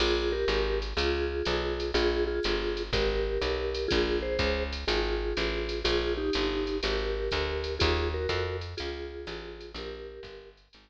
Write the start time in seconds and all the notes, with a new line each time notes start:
0.00 A#1 F4 G#4, crash, ride
0.32 G4 A#4
0.48 G#1, hi-hat pedal, ride
0.82 ride
0.97 C#2 F4 G#4, ride
1.45 B1, hi-hat pedal, ride
1.80 ride
1.94 A#1 F4 G#4, ride
2.27 F4 G#4
2.43 G1, hi-hat pedal, ride
2.77 ride
2.93 G#1 G4 A#4, kick, ride
3.41 B1, hi-hat pedal, ride
3.74 ride
3.88 A#1 F4 G#4, kick, ride
4.23 G#4 C5
4.39 C#2, kick, hi-hat pedal, ride
4.73 ride
4.88 G#1 F4 G#4, ride
5.37 A1, hi-hat pedal, ride
5.69 ride
5.84 A#1 F4 G#4, ride
6.17 D#4 G4
6.33 G1, hi-hat pedal, ride
6.67 ride
6.83 G#1 G4 A#4, ride
7.31 D2, kick, hi-hat pedal, ride
7.64 ride
7.79 D#2 F4 G#4, kick, ride
8.14 F#4 A#4
8.29 F2, kick, hi-hat pedal, ride
8.61 ride
8.77 C#2 F4 G#4, ride
9.27 A1, hi-hat pedal, ride
9.61 ride
9.74 A#1 G4 A#4, ride
10.23 G1, kick, hi-hat pedal, ride
10.57 ride
10.73 G#1, ride